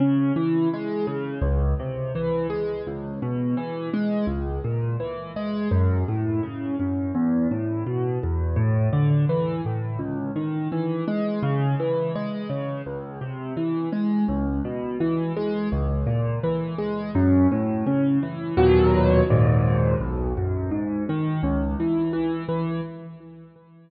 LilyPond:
\new Staff { \clef bass \time 4/4 \key cis \minor \tempo 4 = 84 cis8 e8 gis8 cis8 cis,8 bis,8 e8 gis8 | cis,8 b,8 e8 gis8 cis,8 ais,8 e8 gis8 | fis,8 a,8 cis8 fis,8 e,8 a,8 b,8 e,8 | a,8 d8 e8 a,8 cis,8 dis8 e8 gis8 |
cis8 e8 gis8 cis8 cis,8 bis,8 e8 gis8 | cis,8 b,8 e8 gis8 cis,8 ais,8 e8 gis8 | fis,8 a,8 cis8 e8 <dis, ais, b, fis>4 <dis, gis, ais,>4 | b,,8 fis,8 gis,8 dis8 cis,8 e8 e8 e8 | }